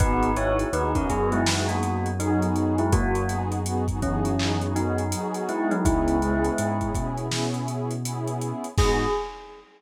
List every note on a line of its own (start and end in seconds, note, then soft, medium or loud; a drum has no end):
0.00 0.65 G#1 loud
0.00 0.31 B3 loud
0.00 0.31 D#4 loud
0.00 0.32 D#4 medium
0.00 0.31 F#4 loud
0.00 0.31 G#4 loud
0.00 0.32 B4 medium
0.00 kick medium
0.00 closed hi-hat medium
0.23 closed hi-hat medium
0.36 0.68 B3 medium
0.36 0.68 D#4 medium
0.36 0.58 E4 medium
0.36 0.68 F#4 medium
0.36 0.68 G#4 medium
0.36 0.58 C#5 medium
0.36 closed hi-hat medium
0.59 closed hi-hat medium
0.73 1.05 D#2 medium
0.73 0.91 B3 medium
0.73 0.91 D#4 loud
0.73 0.95 D#4 medium
0.73 0.91 F#4 medium
0.73 0.91 G#4 medium
0.73 0.95 B4 medium
0.73 closed hi-hat medium
0.95 1.07 B3 medium
0.95 1.09 C#4 medium
0.95 1.07 D#4 medium
0.95 1.07 F#4 medium
0.95 1.07 G#4 medium
0.95 1.09 A#4 medium
0.95 kick medium
0.95 closed hi-hat medium
1.09 5.14 F#2 medium
1.09 1.40 B3 medium
1.09 1.31 B3 medium
1.09 1.40 D#4 medium
1.09 1.40 F#4 medium
1.09 1.40 G#4 loud
1.09 1.31 G#4 medium
1.09 kick medium
1.09 closed hi-hat medium
1.32 1.60 G#3 medium
1.32 1.60 E4 medium
1.32 closed hi-hat medium
1.46 2.08 B3 medium
1.46 2.08 D#4 medium
1.46 2.08 F#4 medium
1.46 2.08 G#4 medium
1.46 snare loud
1.68 2.02 A#3 medium
1.68 2.02 F#4 medium
1.68 closed hi-hat medium
1.83 closed hi-hat medium
2.06 closed hi-hat medium
2.20 2.74 F#3 medium
2.20 2.82 B3 medium
2.20 2.74 D#4 medium
2.20 2.82 D#4 medium
2.20 2.82 F#4 medium
2.20 2.82 G#4 medium
2.20 closed hi-hat medium
2.42 closed hi-hat medium
2.56 closed hi-hat medium
2.78 2.92 G#3 medium
2.78 2.92 E4 medium
2.78 closed hi-hat medium
2.92 3.24 A#3 medium
2.92 3.24 F#4 medium
2.92 kick loud
2.92 closed hi-hat medium
3.15 closed hi-hat medium
3.29 3.60 B3 medium
3.29 3.60 D#4 medium
3.29 3.60 F#4 medium
3.29 3.60 G#4 loud
3.29 closed hi-hat medium
3.52 closed hi-hat medium
3.66 3.84 B3 loud
3.66 3.84 D#4 medium
3.66 3.84 F#4 medium
3.66 3.84 G#4 medium
3.66 closed hi-hat medium
3.88 3.99 B3 medium
3.88 3.99 D#4 medium
3.88 3.99 F#4 medium
3.88 3.99 G#4 medium
3.88 kick medium
3.88 closed hi-hat medium
4.02 4.57 E3 medium
4.02 4.34 B3 medium
4.02 4.57 C#4 medium
4.02 4.34 D#4 medium
4.02 4.34 F#4 medium
4.02 4.34 G#4 loud
4.02 kick medium
4.02 closed hi-hat medium
4.25 closed hi-hat medium
4.39 5.01 B3 medium
4.39 5.01 D#4 medium
4.39 5.01 F#4 medium
4.39 5.01 G#4 medium
4.39 clap loud
4.61 closed hi-hat medium
4.76 5.42 F#3 medium
4.76 5.42 D#4 medium
4.76 closed hi-hat medium
4.98 closed hi-hat medium
5.12 5.74 B3 medium
5.12 5.74 D#4 medium
5.12 5.74 F#4 medium
5.12 5.74 G#4 loud
5.12 closed hi-hat loud
5.34 closed hi-hat medium
5.49 5.70 G#3 medium
5.49 5.70 E4 medium
5.49 closed hi-hat medium
5.71 5.84 F#3 medium
5.71 5.84 D#4 medium
5.71 closed hi-hat medium
5.85 6.50 C#2 loud
5.85 6.87 G#3 medium
5.85 6.16 B3 loud
5.85 6.16 C#4 loud
5.85 6.87 E4 medium
5.85 6.16 E4 loud
5.85 6.16 G#4 medium
5.85 kick medium
5.85 closed hi-hat medium
6.08 closed hi-hat medium
6.21 6.52 B3 medium
6.21 6.52 C#4 medium
6.21 6.52 E4 medium
6.21 6.52 G#4 medium
6.21 closed hi-hat medium
6.45 closed hi-hat medium
6.58 6.91 G#2 medium
6.58 6.76 B3 medium
6.58 6.76 C#4 medium
6.58 6.76 E4 loud
6.58 6.76 G#4 medium
6.58 closed hi-hat medium
6.81 6.93 B3 medium
6.81 6.93 C#4 medium
6.81 6.93 E4 medium
6.81 6.93 G#4 medium
6.81 kick medium
6.81 closed hi-hat medium
6.95 8.53 B2 medium
6.95 7.26 B3 medium
6.95 7.26 C#4 medium
6.95 7.26 E4 medium
6.95 7.26 G#4 medium
6.95 kick medium
6.95 closed hi-hat medium
7.18 closed hi-hat medium
7.32 7.93 B3 medium
7.32 7.93 C#4 medium
7.32 7.93 E4 medium
7.32 7.93 G#4 medium
7.32 snare medium
7.54 closed hi-hat medium
7.68 closed hi-hat medium
7.91 closed hi-hat medium
8.05 8.67 B3 medium
8.05 8.67 C#4 medium
8.05 8.67 E4 medium
8.05 8.67 G#4 medium
8.05 closed hi-hat loud
8.27 closed hi-hat medium
8.41 closed hi-hat medium
8.64 closed hi-hat medium
8.78 9.06 G#2 loud
8.78 9.06 B3 loud
8.78 9.06 D#4 loud
8.78 9.06 F#4 loud
8.78 9.06 G#4 loud
8.78 kick loud
8.78 crash loud